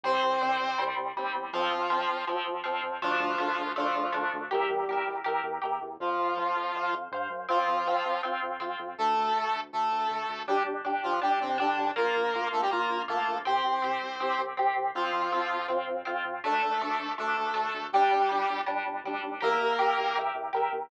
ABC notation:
X:1
M:4/4
L:1/16
Q:1/4=161
K:F
V:1 name="Lead 1 (square)"
[Cc]10 z6 | [F,F]8 z8 | [F,F]8 [F,F]8 | [G,G]8 z8 |
[F,F]12 z4 | [F,F]8 z8 | [A,A]8 [A,A]8 | [G,G]2 z4 [F,F]2 [G,G]2 [C,C]2 [D,D]4 |
[B,B]6 [A,A] [G,G] [B,B]4 [A,A]4 | [Cc]12 z4 | [F,F]8 z8 | [A,A]8 [A,A]8 |
[G,G]8 z8 | [B,B]10 z6 |]
V:2 name="Overdriven Guitar"
[G,C]4 [G,C]4 [G,C]4 [G,C]4 | [F,C]4 [F,C]4 [F,C]4 [F,C]4 | [A,D]4 [A,D]4 [A,D]4 [A,D]4 | [GBe]4 [GBe]4 [GBe]4 [GBe]4 |
[cf]4 [cf]4 [cf]4 [cf]4 | [CF]4 [CF]4 [CF]4 [CF]4 | z16 | [DG]4 [DG]4 [DG]4 [DG]4 |
[B,F]4 [B,F]4 [B,F]4 [B,F]4 | [CG]4 [CG]4 [CG]4 [CG]4 | [CF]4 [CF]4 [CF]4 [CF]4 | [A,D]4 [A,D]4 [A,D]4 [A,D]4 |
[G,D]4 [G,D]4 [G,D]4 [G,D]4 | [GBe]4 [GBe]4 [GBe]4 [GBe]4 |]
V:3 name="Synth Bass 1" clef=bass
C,,2 C,,2 C,,2 C,,2 C,,2 C,,2 _E,,2 =E,,2 | F,,2 F,,2 F,,2 F,,2 F,,2 F,,2 F,,2 F,,2 | D,,2 D,,2 D,,2 D,,2 D,,2 D,,2 D,,2 D,,2 | E,,2 E,,2 E,,2 E,,2 E,,2 E,,2 E,,2 E,,2 |
F,,2 F,,2 F,,2 F,,2 F,,2 F,,2 G,,2 _G,,2 | F,,2 F,,2 F,,2 F,,2 F,,2 F,,2 F,,2 F,,2 | D,,2 D,,2 D,,2 D,,2 D,,2 D,,2 D,,2 D,,2 | G,,,2 G,,,2 G,,,2 G,,,2 G,,,2 G,,,2 G,,,2 G,,,2 |
B,,,2 B,,,2 B,,,2 B,,,2 B,,,2 B,,,2 B,,,2 B,,,2 | C,,2 C,,2 C,,2 C,,2 C,,2 C,,2 C,,2 C,,2 | F,,2 F,,2 F,,2 F,,2 F,,2 F,,2 F,,2 F,,2 | D,,2 D,,2 D,,2 D,,2 D,,2 D,,2 D,,2 D,,2 |
G,,,2 G,,,2 G,,,2 G,,,2 G,,,2 G,,,2 D,,2 _E,,2 | E,,2 E,,2 E,,2 E,,2 E,,2 E,,2 E,,2 E,,2 |]